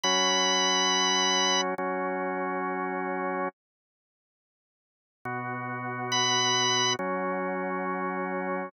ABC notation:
X:1
M:4/4
L:1/8
Q:1/4=138
K:B
V:1 name="Drawbar Organ"
b8 | z8 | z8 | z4 b4 |
z8 |]
V:2 name="Drawbar Organ"
[F,CF]8 | [F,CF]8 | z8 | [B,,B,F]8 |
[F,CF]8 |]